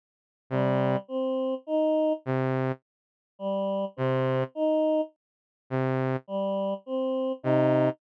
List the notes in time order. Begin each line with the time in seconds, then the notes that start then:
0.50 C3 G3
1.08 C4
1.67 D#4
2.25 C3
3.39 G3
3.96 C3 C4
4.55 D#4
5.70 C3
6.27 G3
6.86 C4
7.43 C3 D#4